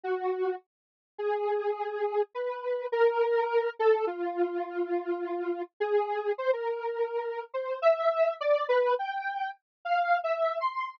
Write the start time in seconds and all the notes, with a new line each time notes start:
0.03 F#4
1.18 G#4
2.34 B4
2.92 A#4
3.79 A4
4.07 F4
5.80 G#4
6.38 C5
6.53 A#4
7.54 C5
7.82 E5
8.41 D5
8.69 B4
8.99 G5
9.85 F5
10.24 E5
10.60 C6